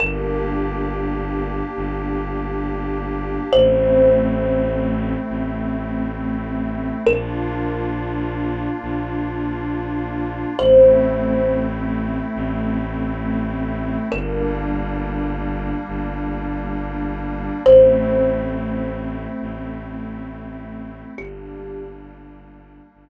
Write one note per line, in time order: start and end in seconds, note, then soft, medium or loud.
0.00 1.62 G1 loud
0.00 3.50 A#3 medium
0.00 3.50 D4 medium
0.00 3.50 G4 medium
0.00 3.28 A#4 medium
1.76 3.39 G1 loud
3.53 5.15 A1 loud
3.53 7.02 A3 medium
3.53 7.02 C4 medium
3.53 7.02 E4 medium
3.53 6.60 C5 medium
5.29 6.92 A1 medium
7.06 8.68 A#1 loud
7.06 10.55 A#3 medium
7.06 10.55 D4 medium
7.06 10.55 F4 medium
7.06 10.37 A#4 medium
8.83 10.45 A#1 loud
10.59 12.21 A1 loud
10.59 14.08 A3 medium
10.59 14.08 C4 medium
10.59 14.08 E4 medium
10.59 11.68 C5 medium
12.35 13.97 A1 loud
14.12 15.74 G1 loud
14.12 17.61 G3 medium
14.12 17.61 A#3 medium
14.12 17.61 D4 medium
14.12 16.97 A#4 medium
15.88 17.51 G1 loud
17.65 19.27 A1 loud
17.65 21.14 A3 medium
17.65 21.14 C4 medium
17.65 21.14 E4 medium
17.65 20.57 C5 medium
19.41 21.03 A1 loud
21.18 22.80 G1 loud
21.18 23.09 G3 medium
21.18 23.09 A#3 medium
21.18 23.09 D4 medium
21.18 22.31 G4 medium
22.94 23.09 G1 loud